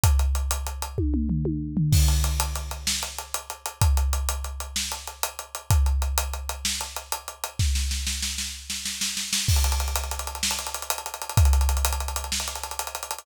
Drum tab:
CC |------------------------|x-----------------------|------------------------|------------------------|
HH |x-x-x-x-x-x-------------|--x-x-x-x-x---x-x-x-x-x-|x-x-x-x-x-x---x-x-x-x-x-|x-x-x-x-x-x---x-x-x-x-x-|
SD |------------------------|------------o-----------|------------o-----------|------------o-----------|
T1 |------------o-----o-----|------------------------|------------------------|------------------------|
T2 |--------------o---------|------------------------|------------------------|------------------------|
FT |----------------o-----o-|------------------------|------------------------|------------------------|
BD |o-----------o-----------|o-----------------------|o-----------------------|o-----------------------|

CC |------------------------|x-----------------------|------------------------|
HH |------------------------|-xxxxxxxxxxx-xxxxxxxxxxx|xxxxxxxxxxxx-xxxxxxxxxxx|
SD |o-o-o-o-o-o---o-o-o-o-o-|------------o-----------|------------o-----------|
T1 |------------------------|------------------------|------------------------|
T2 |------------------------|------------------------|------------------------|
FT |------------------------|------------------------|------------------------|
BD |o-----------------------|o-----------------------|o-----------------------|